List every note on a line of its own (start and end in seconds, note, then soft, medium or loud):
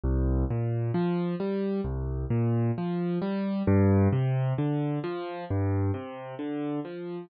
0.03 0.44 C2 loud
0.50 0.91 A#2 medium
0.94 1.35 F3 medium
1.40 1.81 G3 medium
1.84 2.25 C2 medium
2.30 2.71 A#2 medium
2.78 3.19 F3 medium
3.22 3.63 G3 medium
3.67 4.08 G2 loud
4.13 4.53 C3 medium
4.58 4.99 D3 medium
5.04 5.45 F3 medium
5.50 5.91 G2 loud
5.94 6.35 C3 medium
6.39 6.80 D3 medium
6.85 7.26 F3 medium